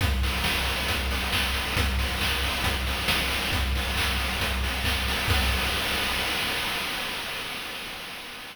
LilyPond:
\new DrumStaff \drummode { \time 4/4 \tempo 4 = 136 <hh bd>8 hho8 <bd sn>8 hho8 <hh bd>8 hho8 <hc bd>8 hho8 | <hh bd>8 hho8 <hc bd>8 hho8 <hh bd>8 hho8 <bd sn>8 hho8 | <hh bd>8 hho8 <hc bd>8 hho8 <hh bd>8 hho8 <hc bd>8 hho8 | <cymc bd>4 r4 r4 r4 | }